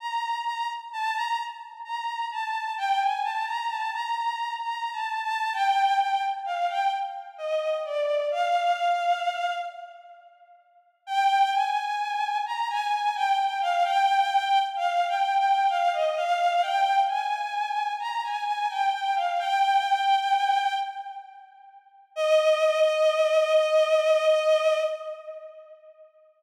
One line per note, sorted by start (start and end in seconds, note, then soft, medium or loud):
0.00 0.39 A#5 medium
0.45 0.67 A#5 medium
0.93 1.15 A5 medium
1.15 1.37 A#5 medium
1.84 2.25 A#5 medium
2.31 2.73 A5 medium
2.78 2.99 G5 medium
3.01 3.23 G#5 medium
3.23 3.45 A5 medium
3.46 3.68 A#5 medium
3.69 3.91 A5 medium
3.93 4.15 A#5 medium
4.16 4.54 A#5 medium
4.61 4.91 A#5 medium
4.92 5.21 A5 medium
5.23 5.52 A5 medium
5.53 5.96 G5 medium
6.00 6.22 G5 medium
6.45 6.67 F5 medium
6.69 6.91 G5 medium
7.38 7.77 D#5 medium
7.85 8.23 D5 medium
8.31 9.53 F5 medium
11.07 11.50 G5 medium
11.53 12.37 G#5 medium
12.46 12.68 A#5 medium
12.70 12.92 G#5 medium
12.93 13.15 G#5 medium
13.15 13.37 G5 medium
13.38 13.60 G5 medium
13.61 13.83 F5 medium
13.84 14.59 G5 medium
14.76 15.05 F5 medium
15.08 15.37 G5 medium
15.39 15.68 G5 medium
15.69 15.91 F5 medium
15.93 16.15 D#5 medium
16.17 16.61 F5 medium
16.62 16.99 G5 medium
17.08 17.91 G#5 medium
17.99 18.21 A#5 medium
18.23 18.45 G#5 medium
18.46 18.68 G#5 medium
18.70 18.92 G5 medium
18.93 19.14 G5 medium
19.15 19.37 F5 medium
19.39 20.73 G5 medium
22.16 24.78 D#5 loud